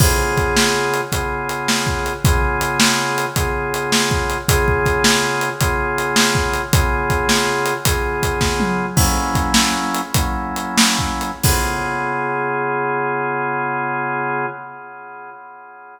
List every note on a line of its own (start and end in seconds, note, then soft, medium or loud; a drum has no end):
0.00 1.01 C#3 loud
0.00 1.01 B3 loud
0.00 1.01 F4 loud
0.00 1.01 G#4 loud
0.00 kick loud
0.00 crash loud
0.37 kick medium
0.37 closed hi-hat medium
0.57 snare loud
0.94 closed hi-hat medium
1.12 2.13 C#3 medium
1.12 2.13 B3 medium
1.12 2.13 F4 medium
1.12 2.13 G#4 medium
1.12 kick medium
1.12 closed hi-hat medium
1.49 closed hi-hat medium
1.68 snare loud
1.87 kick medium
2.06 closed hi-hat medium
2.25 3.26 C#3 loud
2.25 3.26 B3 loud
2.25 3.26 F4 medium
2.25 3.26 G#4 loud
2.25 kick loud
2.25 closed hi-hat loud
2.61 closed hi-hat medium
2.80 snare loud
3.18 closed hi-hat medium
3.36 4.38 C#3 medium
3.36 4.38 B3 medium
3.36 4.38 F4 medium
3.36 4.38 G#4 medium
3.36 kick medium
3.36 closed hi-hat loud
3.74 closed hi-hat medium
3.92 snare loud
4.11 kick medium
4.30 closed hi-hat medium
4.48 5.49 C#3 loud
4.48 5.49 B3 loud
4.48 5.49 F4 loud
4.48 5.49 G#4 loud
4.48 kick loud
4.48 closed hi-hat loud
4.68 kick medium
4.86 kick medium
4.86 closed hi-hat medium
5.04 snare loud
5.41 closed hi-hat medium
5.61 6.62 C#3 medium
5.61 6.62 B3 medium
5.61 6.62 F4 medium
5.61 6.62 G#4 medium
5.61 kick loud
5.61 closed hi-hat loud
5.98 closed hi-hat medium
6.16 snare loud
6.35 kick medium
6.54 closed hi-hat medium
6.73 7.74 C#3 medium
6.73 7.74 B3 loud
6.73 7.74 F4 loud
6.73 7.74 G#4 loud
6.73 kick loud
6.73 closed hi-hat loud
7.10 kick medium
7.10 closed hi-hat medium
7.29 snare loud
7.66 closed hi-hat medium
7.85 8.86 C#3 medium
7.85 8.86 B3 medium
7.85 8.86 F4 medium
7.85 8.86 G#4 medium
7.85 kick loud
7.85 closed hi-hat loud
8.23 kick medium
8.23 closed hi-hat medium
8.41 kick medium
8.41 snare medium
8.60 high tom medium
8.96 10.02 F#3 medium
8.96 10.02 A#3 loud
8.96 10.02 C#4 loud
8.96 10.02 E4 loud
8.96 kick loud
8.96 crash loud
9.35 kick medium
9.35 closed hi-hat medium
9.54 snare loud
9.95 closed hi-hat medium
10.14 11.31 F#3 medium
10.14 11.31 A#3 medium
10.14 11.31 C#4 medium
10.14 11.31 E4 medium
10.14 kick loud
10.14 closed hi-hat loud
10.56 closed hi-hat medium
10.78 snare loud
10.99 kick medium
11.21 closed hi-hat medium
11.43 14.46 C#3 medium
11.43 14.46 B3 loud
11.43 14.46 F4 medium
11.43 14.46 G#4 medium
11.43 kick loud
11.43 crash loud